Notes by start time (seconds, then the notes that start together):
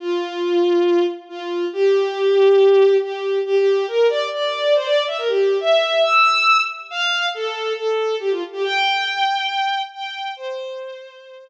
0.00 F4
1.29 F4
1.73 G4
3.02 G4
3.46 G4
3.56 G4
3.88 A#4
4.09 D5
4.33 D5
4.75 C5
4.84 D5
5.07 E5
5.18 A#4
5.28 G4
5.60 E5
6.03 E6
6.90 F5
7.34 A4
7.77 A4
8.20 G4
8.31 F4
8.52 G4
8.64 G5
9.94 G5
10.36 C5